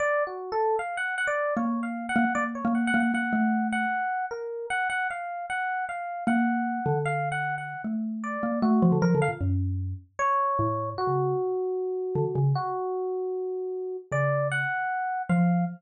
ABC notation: X:1
M:4/4
L:1/16
Q:1/4=153
K:none
V:1 name="Xylophone"
z16 | ^A,6 A, z A,3 A,3 A,2 | ^A,2 =A,6 z8 | z16 |
^A,6 D,10 | A,6 ^A,2 =A,2 F, D, (3F,2 D,2 ^A,,2 | ^F,,6 z6 A,,4 | z ^C,3 z8 D, z C,2 |
z16 | ^C,6 z6 F,4 |]
V:2 name="Electric Piano 1"
(3d4 ^F4 A4 =f2 ^f2 f d3 | (3^c4 f4 ^f4 d z c2 (3f2 f2 f2 | ^f6 f6 ^A4 | ^f2 f2 =f4 ^f4 =f4 |
^f8 (3=f4 ^f4 f4 | z4 d4 ^F4 ^A2 =f z | z8 ^c8 | ^F16 |
^F16 | d4 ^f8 =f4 |]